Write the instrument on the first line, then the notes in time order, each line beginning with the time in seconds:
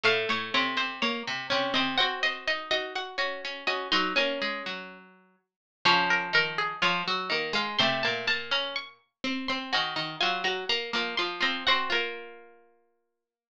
pizzicato strings
0.03 A2 A3 F5
0.29 A2 A3 C#5
0.54 C3 C4 C#5
0.77 C3 C4 C5
1.02 A#3 C#5
1.27 C3 C4
1.50 C3 C4 C#4
1.74 C3 C4 D#5
1.97 C4 F#4 C5 F#5
2.23 C4 C5 D#5
2.47 D#4 D#5
2.71 D#4 F#4 D#5
2.95 F#4 F#5
3.18 C#4 F#4 C#5
3.45 C#4 C#5
3.67 C#4 F#4 C#5 D#5
3.92 F#3 D#4 F#4 C6
4.16 A#3 C#4 A#4 G#5
4.42 G#3 G#4
4.66 F#3 F#4
5.85 C#3 F3 C#4 C#5
6.10 A#4
6.33 D#3 D#4 A#4
6.58 G#4
6.82 F3 F4 C#5
7.07 F#3 F#4
7.30 D#3 A#3 D#4
7.53 G#3 F5
7.79 C3 A3 C4 C6
8.03 A#2 A#3 A5
8.27 A#3 A5
8.51 C#4 A#5
8.76 C#6
9.24 C4
9.48 C4 C6
9.73 D#3 D#4 F#4 G#5
9.96 D#3 D#4
10.20 F#3 F4 F#4 G#5
10.44 F#3 F#4 A#5
10.69 A#3 A#5
10.93 F3 A#3 F4
11.17 F3 F4 C6
11.40 F3 C4 F4 A#5
11.67 C4 F#4 C5 F#5
11.90 A#3 F4 A#4